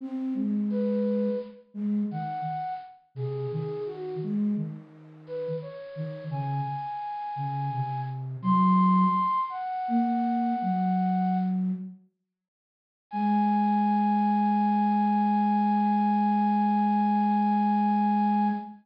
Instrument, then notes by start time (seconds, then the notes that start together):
flute
0.01 C4
0.35 G#3
0.70 B4
1.74 G#3
2.11 D#3 F#5
3.15 C3 G#4
3.51 D#3 G#4
3.86 F#4
4.23 G#3
4.56 D#3
5.27 B4
5.62 C#5
5.96 D#3
6.30 C#3 G#5
7.36 C#3
7.70 C3
8.42 F#3 C6
9.49 F#5
9.88 A#3
10.62 F#3
13.11 G#3 G#5